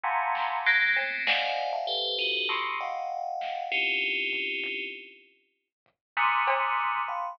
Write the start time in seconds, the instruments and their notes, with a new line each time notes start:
0.03 tubular bells F2 F#2 G2 G#2 A#2 C3
0.35 snare
0.66 tubular bells F#3 G#3 A#3, closed hi-hat
0.96 tubular bells A3 A#3 B3 C4, cowbell
1.27 tubular bells C5 D5 D#5 F5 F#5 G#5, snare
1.73 tubular bells E5 F5 G5 A5
1.87 tubular bells G4 A4 B4 C5
2.19 tubular bells D#4 F4 F#4 G4 A4
2.49 tubular bells A2 B2 C3, snare
2.80 tubular bells D#5 F5 F#5 G5
3.41 snare
3.72 tubular bells C4 C#4 D#4 E4 F4 G4
4.33 floor tom
4.64 kick
5.86 kick
6.17 tubular bells G#2 A#2 C3 D3 D#3, high tom
6.47 cowbell
6.78 closed hi-hat
7.08 tubular bells F5 G5 A5 B5 C6